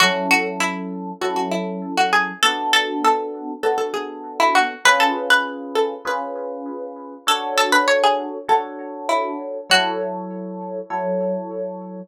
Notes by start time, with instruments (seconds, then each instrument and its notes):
0.00 electric piano 1 F#3 C#4 E4 A4, pizzicato strings F#4
0.31 pizzicato strings F#4
0.60 pizzicato strings E4
1.21 electric piano 1 F#3 C#4 E4 A4, pizzicato strings F#4
1.36 pizzicato strings F#4
1.52 pizzicato strings E4
1.97 pizzicato strings F#4
2.13 pizzicato strings G#4
2.43 electric piano 1 B3 D4 F#4 A4, pizzicato strings A4
2.73 pizzicato strings A4
3.05 pizzicato strings A4
3.63 electric piano 1 B3 D4 F#4 A4, pizzicato strings A4
3.78 pizzicato strings A4
3.94 pizzicato strings G#4
4.40 pizzicato strings E4
4.55 pizzicato strings F#4
4.85 electric piano 1 C#4 F4 G#4 B4, pizzicato strings B4
5.00 pizzicato strings A4
5.30 pizzicato strings B4
5.75 pizzicato strings A4
6.05 electric piano 1 C#4 F4 G#4 B4, pizzicato strings B4
7.27 electric piano 1 D4 F#4 A4 C#5, pizzicato strings A4
7.58 pizzicato strings A4
7.72 pizzicato strings B4
7.88 pizzicato strings C#5
8.04 pizzicato strings G#4
8.48 electric piano 1 D4 F#4 A4 C#5, pizzicato strings A4
9.09 pizzicato strings E4
9.70 electric piano 1 F#3 E4 A4 C#5, pizzicato strings F#4
10.90 electric piano 1 F#3 E4 A4 C#5